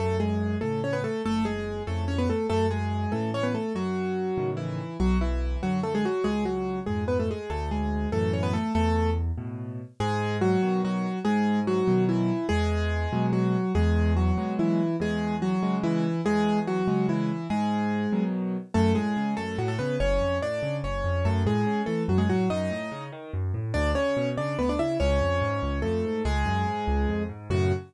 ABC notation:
X:1
M:6/8
L:1/16
Q:3/8=96
K:F#m
V:1 name="Acoustic Grand Piano"
[A,A]2 [G,G]4 [A,A]2 [Cc] [B,B] [A,A]2 | [A,A]2 [G,G]4 [A,A]2 [Cc] [B,B] [A,A]2 | [A,A]2 [G,G]4 [A,A]2 [Cc] [B,B] [A,A]2 | [F,F]8 [E,E]4 |
[F,F]2 [E,E]4 [F,F]2 [A,A] [G,G] [F,F]2 | [G,G]2 [F,F]4 [G,G]2 [B,B] [A,A] [G,G]2 | [A,A]2 [G,G]4 [A,A]2 [Cc] [B,B] [A,A]2 | [A,A]4 z8 |
[K:G#m] [G,G]4 [F,F]4 [F,F]4 | [G,G]4 [F,F]4 [E,E]4 | [G,G]8 [F,F]4 | [G,G]4 [F,F]4 [E,E]4 |
[G,G]4 [F,F]4 [E,E]4 | [G,G]4 [F,F]4 [E,E]4 | [G,G]8 z4 | [K:F#m] [A,A]2 [G,G]4 [A,A]2 [F,F] [A,A] [B,B]2 |
[Cc]4 [Dd]4 [Cc]4 | [A,A]2 [G,G]4 [A,A]2 [F,F] [G,G] [F,F]2 | [^D^d]6 z6 | [Dd]2 [Cc]4 [Dd]2 [B,B] [Dd] [Ee]2 |
[Cc]8 [A,A]4 | [G,G]10 z2 | F6 z6 |]
V:2 name="Acoustic Grand Piano" clef=bass
F,,6 [A,,C,]6 | F,,,6 [^E,,A,,C,]6 | F,,6 [A,,C,E,]6 | F,,6 [A,,C,^D,]6 |
B,,,6 [F,,D,]6 | C,,6 [^E,,G,,]6 | D,,6 [F,,A,,E,]6 | E,,6 [A,,B,,]6 |
[K:G#m] G,,6 [B,,D,F,]6 | G,,6 [B,,D,F,]6 | E,,6 [B,,F,G,]6 | E,,6 [B,,F,G,]6 |
E,,6 [C,G,]6 | E,,6 [C,G,]6 | G,,6 [B,,D,F,]6 | [K:F#m] F,,2 A,,2 C,2 F,,2 A,,2 C,2 |
F,,,2 ^E,,2 A,,2 C,2 F,,,2 E,,2 | F,,2 A,,2 C,2 E,2 F,,2 A,,2 | F,,2 A,,2 C,2 ^D,2 F,,2 A,,2 | D,,2 C,2 B,,2 C,2 D,,2 C,2 |
C,,2 ^E,,2 G,,2 C,,2 E,,2 G,,2 | C,,2 F,,2 G,,2 C,,2 ^E,,2 G,,2 | [F,,A,,C,]6 z6 |]